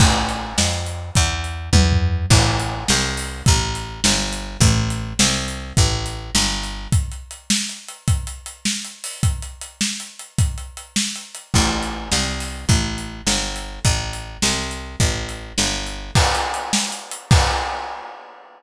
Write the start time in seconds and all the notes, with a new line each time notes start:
0.00 A1, kick, crash
0.29 closed hi-hat
0.58 F2, snare
0.86 closed hi-hat
1.15 E2, kick, closed hi-hat
1.44 closed hi-hat
1.73 E2, kick, high tom
1.92 floor tom
2.30 A1, kick, crash
2.60 closed hi-hat
2.88 C2, snare
3.17 open hi-hat
3.46 A1, kick, closed hi-hat
3.75 closed hi-hat
4.04 G1, snare
4.33 closed hi-hat
4.60 A1, kick, closed hi-hat
4.90 closed hi-hat
5.19 C2, snare
5.48 closed hi-hat
5.77 A1, kick, closed hi-hat
6.06 closed hi-hat
6.35 G1, snare
6.63 closed hi-hat
6.92 kick, closed hi-hat
7.12 closed hi-hat
7.31 closed hi-hat
7.50 snare
7.69 closed hi-hat
7.88 closed hi-hat
8.08 kick, closed hi-hat
8.27 closed hi-hat
8.46 closed hi-hat
8.65 snare
8.85 closed hi-hat
9.04 open hi-hat
9.23 kick, closed hi-hat
9.42 closed hi-hat
9.61 closed hi-hat
9.81 snare
10.00 closed hi-hat
10.19 closed hi-hat
10.38 kick, closed hi-hat
10.58 closed hi-hat
10.77 closed hi-hat
10.96 snare
11.16 closed hi-hat
11.35 closed hi-hat
11.54 A1, kick, crash
11.83 closed hi-hat
12.12 C2, snare
12.40 open hi-hat
12.69 A1, kick, closed hi-hat
12.98 closed hi-hat
13.27 G1, snare
13.56 closed hi-hat
13.85 A1, kick, closed hi-hat
14.13 closed hi-hat
14.42 C2, snare
14.71 closed hi-hat
15.00 A1, kick, closed hi-hat
15.29 closed hi-hat
15.58 G1, snare
15.87 closed hi-hat
16.15 kick, crash
16.35 closed hi-hat
16.54 closed hi-hat
16.73 snare
16.92 closed hi-hat
17.11 closed hi-hat
17.31 kick, crash